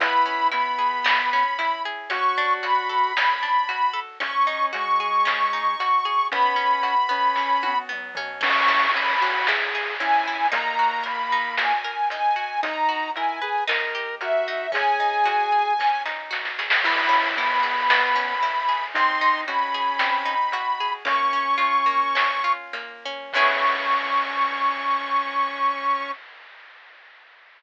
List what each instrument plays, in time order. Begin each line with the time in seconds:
0.00 synth bass 1 C#2, orchestral harp B3, lead 1 (square) E4, ocarina B5, kick, closed hi-hat
0.26 orchestral harp C#4
0.52 lead 1 (square) B3, orchestral harp E4, ocarina B5, closed hi-hat
0.79 orchestral harp G#4
1.04 orchestral harp B3, snare
1.33 orchestral harp C#4
1.59 orchestral harp E4, closed hi-hat
1.85 orchestral harp G#4
2.10 synth bass 1 D2, orchestral harp C#4, lead 1 (square) F#4, ocarina C#6, kick, closed hi-hat
2.38 orchestral harp D4
2.63 orchestral harp F#4, ocarina B5, closed hi-hat
2.89 orchestral harp A4
3.17 orchestral harp C#4, snare
3.43 orchestral harp D4
3.69 orchestral harp F#4, closed hi-hat
3.93 orchestral harp A4
4.20 synth bass 1 G#1, orchestral harp C#4, lead 1 (square) C#4, ocarina C#6, kick, closed hi-hat
4.47 orchestral harp D#4
4.73 lead 1 (square) G#3, orchestral harp F#4, ocarina C#6, closed hi-hat
5.00 orchestral harp G#4
5.25 orchestral harp C#4, snare
5.53 orchestral harp D#4
5.80 orchestral harp F#4, closed hi-hat
6.05 orchestral harp G#4
6.31 synth bass 1 B1, orchestral harp B3, lead 1 (square) C#4, ocarina B5, kick, closed hi-hat
6.56 orchestral harp C#4
6.83 orchestral harp F#4, closed hi-hat
7.09 orchestral harp B3, lead 1 (square) C#4
7.36 orchestral harp C#4, kick, snare
7.63 orchestral harp F#4, high tom
7.89 orchestral harp B3, mid tom
8.15 orchestral harp C#4, floor tom
8.41 synth bass 1 C#2, orchestral harp C#4, lead 1 (square) C#4, ocarina C#6, kick, crash
8.68 orchestral harp E4
8.94 lead 1 (square) C#4, orchestral harp G#4, ocarina B5, closed hi-hat
9.21 orchestral harp C#4, lead 1 (square) F#4
9.47 orchestral harp E4, lead 1 (square) G#4, snare
9.75 orchestral harp G#4
10.00 orchestral harp C#4, lead 1 (square) E4, ocarina G#5, closed hi-hat
10.28 orchestral harp E4
10.52 synth bass 1 D#2, lead 1 (square) A#3, orchestral harp D#4, ocarina A#5, kick, closed hi-hat
10.79 orchestral harp F#4
11.04 orchestral harp A#4, ocarina B5, closed hi-hat
11.32 orchestral harp D#4
11.57 orchestral harp F#4, ocarina G#5, snare
11.84 orchestral harp A#4
12.10 orchestral harp D#4, ocarina G#5, closed hi-hat
12.36 orchestral harp F#4
12.63 synth bass 1 B1, lead 1 (square) D#4, orchestral harp D#4, ocarina A#5, kick, closed hi-hat
12.89 orchestral harp F#4
13.16 lead 1 (square) E4, orchestral harp A#4, ocarina G#5, closed hi-hat
13.42 lead 1 (square) G#4, orchestral harp B4
13.67 synth bass 1 D#2, orchestral harp D#4, lead 1 (square) A#4, snare
13.95 orchestral harp G4
14.21 lead 1 (square) F#4, orchestral harp A#4, ocarina E5, closed hi-hat
14.48 orchestral harp D#4
14.72 synth bass 1 G#1, orchestral harp C#4, lead 1 (square) G#4, ocarina G#5, kick, closed hi-hat
15.00 orchestral harp D#4
15.25 orchestral harp F#4, closed hi-hat
15.52 orchestral harp G#4
15.79 orchestral harp C#4, kick, snare
16.05 orchestral harp D#4, snare
16.31 orchestral harp F#4, snare
16.45 snare
16.59 orchestral harp G#4, snare
16.70 snare
16.83 synth bass 1 C#2, orchestral harp B3, lead 1 (square) E4, ocarina B5, kick, crash
17.09 orchestral harp C#4
17.36 lead 1 (square) B3, orchestral harp E4, ocarina B5, closed hi-hat
17.63 orchestral harp G#4
17.90 orchestral harp B3, snare
18.16 orchestral harp C#4
18.43 orchestral harp E4, closed hi-hat
18.69 orchestral harp G#4
18.94 synth bass 1 G#1, orchestral harp C4, lead 1 (square) D#4, ocarina C6, kick, closed hi-hat
19.21 orchestral harp D#4
19.47 lead 1 (square) C#4, orchestral harp F#4, ocarina B5, closed hi-hat
19.74 orchestral harp G#4
19.99 orchestral harp C4, snare
20.25 orchestral harp D#4
20.52 orchestral harp F#4, closed hi-hat
20.80 orchestral harp G#4
21.05 synth bass 1 A#1, orchestral harp A#3, lead 1 (square) C#4, ocarina C#6, kick, closed hi-hat
21.33 orchestral harp C#4
21.58 orchestral harp F4, closed hi-hat
21.86 orchestral harp A#3
22.15 orchestral harp C#4, snare
22.44 orchestral harp F4
22.73 orchestral harp A#3, closed hi-hat
23.05 orchestral harp C#4
23.33 synth bass 1 C#2, orchestral harp B3 C#4 E4 G#4, lead 1 (square) C#4, ocarina C#6, kick, crash